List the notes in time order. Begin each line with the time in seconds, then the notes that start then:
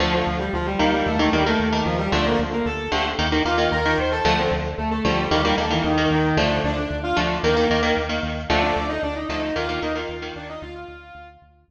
0.00 D2 D3 F3 A3 F4
0.13 F3 F4
0.27 D2
0.39 G3 G4
0.53 D2 F3 F4
0.66 G3 G4
0.79 D2 D#3 G3 A#3 G4
0.93 G3 G4
1.06 D#2 A3 A4
1.19 D#3 A3 A#3 A4
1.33 D#2 D#3 G3 A#3 G4
1.46 D#3 A3 A#3 A4
1.60 D#2
1.72 D#3 A#3
1.85 D#2 F3 F4
1.98 G3 G4
2.12 D2 D3 F3 A3 D4 D5
2.26 A#3 A#4
2.39 D2
2.53 A#3 A#4
2.65 D2 A4 A5
2.92 D2 D3 F3 A3 G4 G5
3.18 D#2 D#3 A#3
3.32 D#3 A#3
3.45 D#2 D#3 A#3 F4 F5
3.58 D#3 A#3
3.71 D#2 A#4 A#5
3.85 D#3 A#3
3.98 D#2 C5 C6
4.12 A4 A5
4.25 D2 D3 F3 A3 A4
4.38 C4 C5
4.51 D2
4.78 D2 A3 A4
4.91 A3 A4
5.05 D2 D3 F3 G3 A3 G4
5.31 D#2 D#3 G3 A#3 G4
5.43 D#3 G3 A#3 G4
5.58 D#2 D#3 A3 A#3 A4
5.70 D#3 E3 A#3 E4
5.84 D#2 D#3 D#4
5.97 D#3 A#3
6.11 D#2 D#3 D#4
6.37 D2 D3 F3 A3 D4 D5
6.64 D2 D4 D5
6.76 D4 D5
6.91 D2
7.03 F4 F5
7.16 D2 D3 F3 A3 D4 D5
7.43 D#2 D#3 A#3 A#4
7.57 D#3 A#3
7.70 D#2 D#3 A#3
7.83 D#3 A#3
7.97 D#2
8.09 D#3 A#3
8.23 D#2
8.50 D2 D3 F3 A3 D4 D5
8.62 D4 D5
8.76 D2
8.89 D#4 D#5
9.03 D2 D4 D5
9.15 D#4 D#5
9.28 D2 D3 F3 A3 D#4 D#5
9.42 D#4 D#5
9.56 D#2 D#3 A#3 F4 F5
9.69 D#3 A#3 F4 F5
9.82 D#2 D#3 A#3 D#4 D#5
9.95 D#3 A#3 F4 F5
10.09 D#2
10.22 D#3 A#3
10.36 D#2 D4 D5
10.49 D#4 D#5
10.62 D2 F4 F5
10.74 F4 F5
10.88 D2
11.15 D2
11.42 D2
11.68 D2